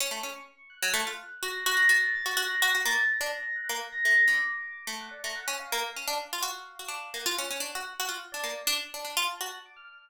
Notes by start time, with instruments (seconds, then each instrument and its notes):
0.00 harpsichord C#4, electric piano 1 C#6
0.11 harpsichord A3
0.23 harpsichord C#4
0.70 electric piano 1 F#6
0.82 harpsichord F#3
0.94 harpsichord A3
1.07 harpsichord F4
1.43 harpsichord F#4, electric piano 1 A#6
1.66 harpsichord F#4
1.77 harpsichord F#4
1.89 harpsichord F#4, electric piano 1 A6
2.15 electric piano 1 A6
2.26 harpsichord F#4
2.37 harpsichord F#4, electric piano 1 A#6
2.61 harpsichord F#4, electric piano 1 A#6
2.75 harpsichord F#4
2.85 harpsichord A#3, electric piano 1 A6
3.09 electric piano 1 A#6
3.21 harpsichord D4
3.35 electric piano 1 A#6
3.56 electric piano 1 F#6
3.69 harpsichord A#3
3.92 electric piano 1 A#6
4.04 harpsichord A3, electric piano 1 A#6
4.28 harpsichord D3, electric piano 1 D6
4.87 harpsichord A3
5.00 electric piano 1 F#5
5.11 electric piano 1 D5
5.24 harpsichord A3, electric piano 1 A#5
5.35 electric piano 1 F#5
5.48 harpsichord C#4
5.59 electric piano 1 F5
5.72 harpsichord A#3, electric piano 1 F5
5.96 harpsichord C#4
6.08 harpsichord D4
6.33 harpsichord F4
6.43 harpsichord F#4
6.79 harpsichord F#4
6.88 harpsichord D4
7.14 harpsichord A#3, electric piano 1 F#5
7.26 harpsichord F4
7.38 harpsichord C#4
7.51 harpsichord C#4
7.60 harpsichord D4
7.75 harpsichord F#4
8.00 harpsichord F#4
8.09 harpsichord F4
8.32 harpsichord D4, electric piano 1 D5
8.44 harpsichord A#3
8.67 harpsichord D4
8.94 harpsichord D4
9.05 harpsichord D4
9.17 harpsichord F4
9.29 electric piano 1 A5
9.41 harpsichord F#4
9.66 electric piano 1 D6
9.76 electric piano 1 F6